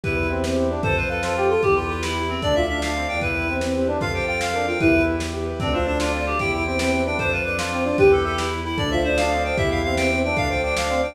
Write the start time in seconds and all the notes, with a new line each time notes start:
0.04 E2 E4 G4 B4, kick, closed hi-hat
0.17 B4
0.23 closed hi-hat
0.30 C4 E5
0.44 C4 B4, snare
0.57 C4 G4
0.63 closed hi-hat
0.70 D4 B4
0.83 F2 A4 C5, kick, closed hi-hat
0.97 B4 C5
1.03 closed hi-hat
1.09 A4 B4 F5
1.23 F4 A4 C5, snare
1.37 G4 A4
1.43 closed hi-hat
1.50 F4 A4 C5
1.62 E2 G4, kick, closed hi-hat
1.76 F4 B4
1.83 closed hi-hat
1.89 F4 E5
2.02 E4 B4, snare
2.16 G4
2.22 closed hi-hat
2.29 C4 B4
2.42 D2 D4 A4 D5, kick, closed hi-hat
2.55 F4 D5 E5
2.62 closed hi-hat
2.69 D4 E5 F5
2.81 D4 D5 F5, snare
2.95 C4 A4
3.01 closed hi-hat
3.08 E2 D4 D5 G5
3.21 E4 G4 B4, kick, closed hi-hat
3.35 B4
3.42 closed hi-hat
3.48 C4 E5
3.61 C4 B4, snare
3.75 C4 G4
3.81 closed hi-hat
3.87 D4 B4
4.00 F2 F4 A4 F5, kick, closed hi-hat
4.14 G4 C5 G5
4.21 closed hi-hat
4.28 F4 F5 G5
4.40 F4 C5 F5, snare
4.54 D4 A#4
4.61 closed hi-hat
4.67 F4 C5 G5
4.80 E2 E4 G4 B4, kick, closed hi-hat
4.94 B4
5.01 closed hi-hat
5.07 E5
5.20 B4, snare
5.34 G4
5.40 closed hi-hat
5.46 B4
5.60 D2 C4 D4 A4, kick, closed hi-hat
5.73 D4 F4 C5
5.80 closed hi-hat
5.86 D4 D5
6.00 D4 F4 F5, snare
6.12 C4 D5
6.20 open hi-hat
6.26 D4 G4 C5
6.39 E2 E4 G4 G5, kick, closed hi-hat
6.53 B4 G5
6.59 closed hi-hat
6.65 C4 E5 G5
6.79 C4 B4 G5, snare
6.92 C4 G4
6.99 closed hi-hat
7.05 D4 B4 G5
7.18 F2 D4 A4 C5, kick, closed hi-hat
7.31 F4 B4 C5
7.39 closed hi-hat
7.45 D4 B4 D5
7.59 D4 F4 F5, snare
7.72 C4 D5
7.79 closed hi-hat
7.84 D4 F4 C5
7.98 E2 G4 B4, kick, closed hi-hat
8.12 A4 B4
8.18 closed hi-hat
8.25 A4 E5
8.38 E4 B4, snare
8.52 G4
8.58 closed hi-hat
8.65 E4 B4
8.78 D2 D4 A4 D5, kick, closed hi-hat
8.91 F4 C5 E5
8.98 closed hi-hat
9.04 D4 C5 D#5
9.17 D4 F5, snare
9.31 C4 D5
9.37 closed hi-hat
9.44 D4 C5 G5
9.57 E2 E4 G4 E5, kick, closed hi-hat
9.71 B4 F5
9.77 closed hi-hat
9.84 C4 E5 F5
9.97 C4 B4 G5, snare
10.11 C4 G4
10.17 closed hi-hat
10.23 D4 B4 G5
10.37 D2 D4 A4 F5, kick, closed hi-hat
10.50 F4 C5 G5
10.57 closed hi-hat
10.63 D4 D5 G5
10.77 D4 F5, snare
10.89 C4 D5
10.96 closed hi-hat
11.03 D4 C5 G5